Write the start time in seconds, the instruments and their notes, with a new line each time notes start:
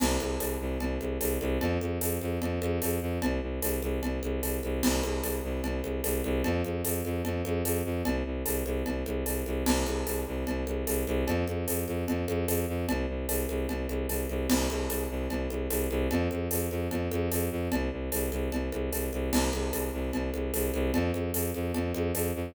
0.00 violin C2, crash, cowbell, low conga
0.20 violin C2, high conga
0.40 violin C2, tambourine, cowbell, high conga
0.60 violin C2
0.80 violin C2, cowbell, low conga
1.01 violin C2, high conga
1.21 violin C2, tambourine, cowbell, high conga
1.41 violin C2, high conga
1.61 violin F2, cowbell, low conga
1.81 violin F2, high conga
2.01 violin F2, tambourine, cowbell, high conga
2.21 violin F2, high conga
2.42 violin F2, cowbell, low conga
2.62 violin F2, high conga
2.82 violin F2, tambourine, cowbell, high conga
3.02 violin F2
3.22 violin C2, cowbell, low conga
3.42 violin C2
3.62 violin C2, tambourine, cowbell, high conga
3.82 violin C2, high conga
4.03 violin C2, cowbell, low conga
4.23 violin C2, high conga
4.43 violin C2, tambourine, cowbell, high conga
4.63 violin C2, high conga
4.83 violin C2, crash, cowbell, low conga
5.04 violin C2, high conga
5.23 violin C2, tambourine, cowbell, high conga
5.44 violin C2
5.64 violin C2, cowbell, low conga
5.83 violin C2, high conga
6.04 violin C2, tambourine, cowbell, high conga
6.24 violin C2, high conga
6.44 violin F2, cowbell, low conga
6.64 violin F2, high conga
6.84 violin F2, tambourine, cowbell, high conga
7.05 violin F2, high conga
7.25 violin F2, cowbell, low conga
7.45 violin F2, high conga
7.65 violin F2, tambourine, cowbell, high conga
7.85 violin F2
8.05 violin C2, cowbell, low conga
8.26 violin C2
8.46 violin C2, tambourine, cowbell, high conga
8.66 violin C2, high conga
8.86 violin C2, cowbell, low conga
9.06 violin C2, high conga
9.26 violin C2, tambourine, cowbell, high conga
9.46 violin C2, high conga
9.66 violin C2, crash, cowbell, low conga
9.86 violin C2, high conga
10.07 violin C2, tambourine, cowbell, high conga
10.27 violin C2
10.47 violin C2, cowbell, low conga
10.67 violin C2, high conga
10.87 violin C2, tambourine, cowbell, high conga
11.07 violin C2, high conga
11.27 violin F2, cowbell, low conga
11.47 violin F2, high conga
11.68 violin F2, tambourine, cowbell, high conga
11.88 violin F2, high conga
12.08 violin F2, cowbell, low conga
12.28 violin F2, high conga
12.48 violin F2, tambourine, cowbell, high conga
12.68 violin F2
12.89 violin C2, cowbell, low conga
13.09 violin C2
13.29 violin C2, tambourine, cowbell, high conga
13.49 violin C2, high conga
13.69 violin C2, cowbell, low conga
13.89 violin C2, high conga
14.09 violin C2, tambourine, cowbell, high conga
14.29 violin C2, high conga
14.50 violin C2, crash, cowbell, low conga
14.70 violin C2, high conga
14.90 violin C2, tambourine, cowbell, high conga
15.10 violin C2
15.30 violin C2, cowbell, low conga
15.50 violin C2, high conga
15.70 violin C2, tambourine, cowbell, high conga
15.90 violin C2, high conga
16.11 violin F2, cowbell, low conga
16.31 violin F2, high conga
16.51 violin F2, tambourine, cowbell, high conga
16.71 violin F2, high conga
16.91 violin F2, cowbell, low conga
17.11 violin F2, high conga
17.32 violin F2, tambourine, cowbell, high conga
17.51 violin F2
17.72 violin C2, cowbell, low conga
17.92 violin C2
18.12 violin C2, tambourine, cowbell, high conga
18.32 violin C2, high conga
18.52 violin C2, cowbell, low conga
18.72 violin C2, high conga
18.92 violin C2, tambourine, cowbell, high conga
19.13 violin C2, high conga
19.32 violin C2, crash, cowbell, low conga
19.53 violin C2, high conga
19.73 violin C2, tambourine, cowbell, high conga
19.93 violin C2
20.13 violin C2, cowbell, low conga
20.34 violin C2, high conga
20.54 violin C2, tambourine, cowbell, high conga
20.74 violin C2, high conga
20.94 violin F2, cowbell, low conga
21.14 violin F2, high conga
21.34 violin F2, tambourine, cowbell, high conga
21.54 violin F2, high conga
21.74 violin F2, cowbell, low conga
21.94 violin F2, high conga
22.15 violin F2, tambourine, cowbell, high conga
22.35 violin F2